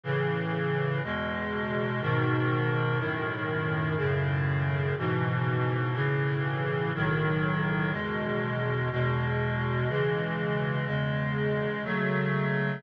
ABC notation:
X:1
M:4/4
L:1/8
Q:1/4=61
K:E
V:1 name="Clarinet"
[A,,C,E,]2 | [E,,B,,G,]2 [G,,B,,D,]2 [F,,A,,D,]2 [F,,A,,C,]2 | [G,,B,,E,]2 [A,,C,E,]2 [B,,,A,,D,F,]2 [E,,B,,G,]2 | [E,,B,,G,]2 [C,E,G,]2 [E,,C,G,]2 [C,F,A,]2 |]